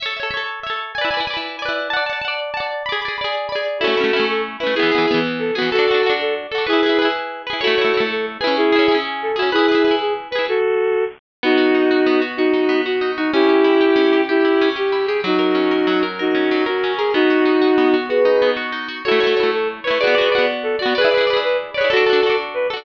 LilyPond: <<
  \new Staff \with { instrumentName = "Violin" } { \time 6/8 \key a \major \tempo 4. = 126 r2. | r2. | r2. | r2. |
<fis' a'>4. a'8 r8 b'8 | <e' gis'>4. r8 a'8 fis'8 | <fis' a'>4. a'8 r8 a'8 | <e' gis'>4. r4. |
<fis' a'>4. a'8 r8 b'8 | <e' gis'>4. r8 a'8 fis'8 | <e' gis'>4. gis'8 r8 b'8 | <fis' a'>2 r4 |
\key b \major <dis' fis'>2. | <dis' fis'>4. fis'4 dis'8 | <e' g'>2. | <e' g'>4. g'4 gis'8 |
<dis' fis'>2. | <dis' fis'>4. fis'4 gis'8 | <dis' fis'>2. | <gis' b'>4. r4. |
\key a \major <fis' a'>4. a'8 r8 b'8 | <gis' b'>4. r8 a'8 fis'8 | <gis' b'>4. b'8 r8 cis''8 | <fis' a'>4. r8 b'8 a'8 | }
  \new Staff \with { instrumentName = "Acoustic Guitar (steel)" } { \time 6/8 \key a \major <a' cis'' e''>8 <a' cis'' e''>8 <a' cis'' e''>4 <a' cis'' e''>4 | <e' b' d'' gis''>8 <e' b' d'' gis''>8 <e' b' d'' gis''>4 <e' b' d'' gis''>4 | <d'' fis'' a''>8 <d'' fis'' a''>8 <d'' fis'' a''>4 <d'' fis'' a''>4 | <gis' d'' b''>8 <gis' d'' b''>8 <gis' d'' b''>4 <gis' d'' b''>4 |
<a cis' e'>8 <a cis' e'>8 <a cis' e'>4. <a cis' e'>8 | <e b gis'>8 <e b gis'>8 <e b gis'>4. <e b gis'>8 | <d' fis' a'>8 <d' fis' a'>8 <d' fis' a'>4. <d' fis' a'>8 | <e' gis' b'>8 <e' gis' b'>8 <e' gis' b'>4. <e' gis' b'>8 |
<a e' cis''>8 <a e' cis''>8 <a e' cis''>4. <cis' e' gis'>8~ | <cis' e' gis'>8 <cis' e' gis'>8 <cis' e' gis'>4. <cis' e' gis'>8 | <e' gis' b'>8 <e' gis' b'>8 <e' gis' b'>4. <e' gis' b'>8 | r2. |
\key b \major b8 fis'8 dis'8 fis'8 b8 fis'8 | fis'8 dis'8 b8 fis'8 dis'8 fis'8 | cis'8 g'8 e'8 g'8 cis'8 g'8 | g'8 e'8 cis'8 g'8 e'8 g'8 |
fis8 ais'8 cis'8 ais'8 fis8 ais'8 | ais'8 cis'8 fis8 ais'8 cis'8 ais'8 | b8 fis'8 dis'8 fis'8 b8 fis'8 | fis'8 dis'8 b8 fis'8 dis'8 fis'8 |
\key a \major <a e' cis''>8 <a e' cis''>8 <a e' cis''>4. <a e' cis''>8 | <b fis' d''>8 <b fis' d''>8 <b fis' d''>4. <b fis' d''>8 | <e' gis' b' d''>8 <e' gis' b' d''>8 <e' gis' b' d''>4. <e' gis' b' d''>8 | <d' fis' a'>8 <d' fis' a'>8 <d' fis' a'>4. <d' fis' a'>8 | }
>>